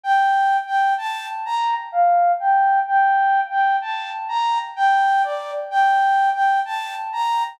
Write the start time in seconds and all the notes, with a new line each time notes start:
0.03 G5
0.67 G5
0.98 A5
1.46 A#5
1.92 F5
2.40 G5
2.88 G5
3.51 G5
3.82 A5
4.29 A#5
4.76 G5
5.24 D5
5.71 G5
6.34 G5
6.65 A5
7.13 A#5